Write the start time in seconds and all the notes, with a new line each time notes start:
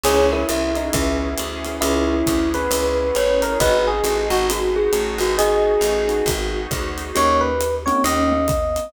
0.04 C#2 B3 C#4 E4 G#4 C#5, crash, ride
0.32 E4 A#4
0.49 C2 E5, hi-hat pedal, ride
0.75 D#4, ride
0.93 C#2 B3 C#4 E4 G#4 E5, kick, ride
1.38 D2, hi-hat pedal, ride
1.65 B3 C#4 E4 G#4, ride
1.81 C#2 B3 C#4 E4 G#4, ride
2.11 B3 C#4 E4 G#4
2.27 D2, kick, hi-hat pedal, ride
2.54 B3 C#4 E4 G#4 B4, ride
2.71 C#2 B3 C#4 E4 G#4, ride
3.15 A1 C#5, hi-hat pedal, ride
3.42 A#4, ride
3.60 G#1 B3 D#4 F#4 G#4 B4 D#5, kick, ride
3.87 G#4
4.04 A1, hi-hat pedal, ride
4.30 G#1 F#4, ride
4.49 B3 D#4 F#4 G#4, ride
4.76 G#4
4.93 A1, hi-hat pedal, ride
5.18 G#1 B3 D#4 F#4 G#4, ride
5.37 B3 D#4 F#4 G#4 D#5, ride
5.81 A1, hi-hat pedal, ride
6.08 B3 D#4 F#4 G#4, ride
6.26 G#1 B3 D#4 F#4 G#4, kick, ride
6.71 D2, kick, hi-hat pedal, ride
6.98 ride
7.15 D#2 A#3 C#4 D#4 G4 C#5, ride
7.41 B4
7.61 hi-hat pedal, ride
7.86 A#3 C4 C#4 D#4 G4 C#5, ride
8.04 D#2 C#4 D#5, ride
8.32 B3
8.48 kick, hi-hat pedal, ride
8.76 ride